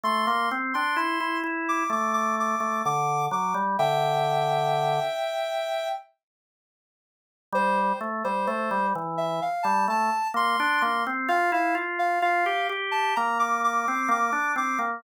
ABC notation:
X:1
M:4/4
L:1/16
Q:1/4=64
K:F
V:1 name="Ocarina"
c' c' z c' c'2 z d' d' d' d'2 d'2 d' z | [eg]10 z6 | c c z c c2 z e f a a2 c'2 c' z | f f z f f2 z a b d' d'2 d'2 d' z |]
V:2 name="Drawbar Organ"
A, B, C D E E E2 A,3 A, D,2 ^F, G, | D,6 z10 | G,2 A, G, A, G, E,2 z G, A, z B, D B, C | F E F2 F G G2 B,3 C B, D C B, |]